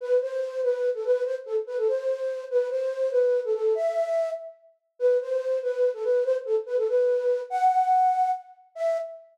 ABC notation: X:1
M:6/8
L:1/16
Q:3/8=96
K:Em
V:1 name="Flute"
B2 c4 B3 A B2 | c z A z B A c6 | B2 c4 B3 A A2 | e6 z6 |
B2 c4 B3 A B2 | c z A z B A B6 | f8 z4 | e6 z6 |]